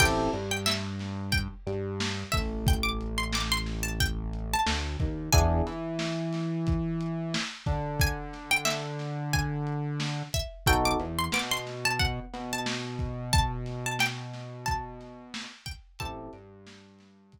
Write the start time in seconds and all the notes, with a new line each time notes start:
0.00 A1 C4 E4 G4 A4 G5, kick, crash
0.33 G2 G3, closed hi-hat
0.51 G5
0.66 E5, snare
0.99 snare, closed hi-hat
1.32 G5, kick, closed hi-hat
1.67 G2 G3, closed hi-hat
2.00 snare
2.32 A1 A3 E5, kick, open hi-hat
2.67 G5, kick, closed hi-hat
2.83 D6
3.01 closed hi-hat
3.18 C6
3.33 D6, snare
3.52 C6
3.66 snare, closed hi-hat
3.83 A5
4.00 G5, kick, closed hi-hat
4.33 closed hi-hat
4.53 A5
4.66 D2 D3, snare
5.00 D#2 D#3, kick, closed hi-hat
5.33 E2 B3 D4 E4 G#4 G#5, kick, closed hi-hat
5.67 E3 E4, closed hi-hat
5.99 snare
6.33 snare, closed hi-hat
6.67 kick, closed hi-hat
7.01 closed hi-hat
7.34 snare
7.66 D3 D4, kick, closed hi-hat
8.00 G#5, kick, closed hi-hat
8.33 snare, closed hi-hat
8.51 G5
8.65 E5, snare
8.99 snare, closed hi-hat
9.33 G#5, kick, closed hi-hat
9.67 closed hi-hat
10.00 snare
10.33 E5, kick, closed hi-hat
10.66 B1 B3 D#4 F#4 A4 G5, kick, closed hi-hat
10.85 D6
11.00 E2 E3, closed hi-hat
11.19 C6
11.32 B2 B3 D6, snare
11.51 C6
11.67 snare, closed hi-hat
11.85 A5
11.99 F#5, kick, closed hi-hat
12.33 B2 B3, snare, closed hi-hat
12.53 A5
12.66 snare
12.99 kick, closed hi-hat
13.33 A5, kick, closed hi-hat
13.66 snare, closed hi-hat
13.86 A5
13.99 G5, snare
14.33 snare, closed hi-hat
14.66 A5, kick, closed hi-hat
15.00 snare, closed hi-hat
15.34 snare
15.66 G5, kick, closed hi-hat
15.99 A1 C4 E4 G4 A4 A5, kick, closed hi-hat
16.33 G2 G3, closed hi-hat
16.67 snare
16.99 snare, closed hi-hat
17.32 kick, closed hi-hat